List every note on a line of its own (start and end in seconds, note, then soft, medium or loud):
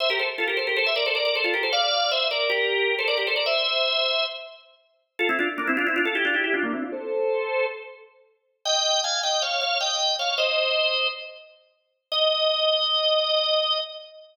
0.00 0.09 C5 medium
0.00 0.09 E5 medium
0.10 0.19 G4 medium
0.10 0.19 A#4 medium
0.19 0.29 A4 medium
0.19 0.29 C5 medium
0.38 0.47 F4 medium
0.38 0.47 A4 medium
0.48 0.57 G4 medium
0.48 0.57 A#4 medium
0.57 0.66 A4 medium
0.57 0.66 C5 medium
0.67 0.76 G4 medium
0.67 0.76 A#4 medium
0.77 0.86 A4 medium
0.77 0.86 C5 medium
0.86 0.96 C5 medium
0.86 0.96 E5 medium
0.96 1.05 A#4 medium
0.96 1.05 D5 medium
1.06 1.15 A4 medium
1.06 1.15 C5 medium
1.15 1.24 A#4 medium
1.15 1.24 D5 medium
1.25 1.34 A#4 medium
1.25 1.34 D5 medium
1.35 1.44 A4 medium
1.35 1.44 C5 medium
1.44 1.53 F4 medium
1.44 1.53 A4 medium
1.54 1.63 G4 medium
1.54 1.63 A#4 medium
1.63 1.72 A4 medium
1.63 1.72 C5 medium
1.73 2.10 D5 medium
1.73 2.10 F5 medium
2.11 2.28 C5 medium
2.11 2.28 E5 medium
2.31 2.49 A#4 medium
2.31 2.49 D5 medium
2.50 2.95 G4 medium
2.50 2.95 A#4 medium
2.99 3.08 A4 medium
2.99 3.08 C5 medium
3.08 3.17 A#4 medium
3.08 3.17 D5 medium
3.17 3.27 G4 medium
3.17 3.27 A#4 medium
3.27 3.36 A4 medium
3.27 3.36 C5 medium
3.36 3.45 A#4 medium
3.36 3.45 D5 medium
3.46 4.24 C5 medium
3.46 4.24 E5 medium
5.19 5.28 F4 medium
5.19 5.28 A4 medium
5.29 5.38 C4 medium
5.29 5.38 E4 medium
5.39 5.48 D4 medium
5.39 5.48 F4 medium
5.58 5.67 A#3 medium
5.58 5.67 D4 medium
5.67 5.77 C4 medium
5.67 5.77 E4 medium
5.77 5.86 D4 medium
5.77 5.86 F4 medium
5.87 5.96 C4 medium
5.87 5.96 E4 medium
5.96 6.05 D4 medium
5.96 6.05 F4 medium
6.05 6.15 F4 medium
6.05 6.15 A4 medium
6.15 6.24 E4 medium
6.15 6.24 G4 medium
6.25 6.34 D4 medium
6.25 6.34 F4 medium
6.34 6.43 E4 medium
6.34 6.43 G4 medium
6.44 6.53 E4 medium
6.44 6.53 G4 medium
6.54 6.63 D4 medium
6.54 6.63 F4 medium
6.63 6.72 A#3 medium
6.63 6.72 D4 medium
6.73 6.82 C4 medium
6.73 6.82 E4 medium
6.82 6.92 D4 medium
6.82 6.92 F4 medium
6.92 7.66 A4 medium
6.92 7.66 C5 medium
8.65 9.01 D#5 medium
8.65 9.01 G5 medium
9.04 9.21 F5 medium
9.04 9.21 G#5 medium
9.23 9.42 D#5 medium
9.23 9.42 G5 medium
9.42 9.61 C#5 medium
9.42 9.61 F5 medium
9.61 9.78 C#5 medium
9.61 9.78 F5 medium
9.81 10.14 D#5 medium
9.81 10.14 G5 medium
10.19 10.37 C#5 medium
10.19 10.37 F5 medium
10.38 11.07 C5 medium
10.38 11.07 D#5 medium
12.12 13.79 D#5 loud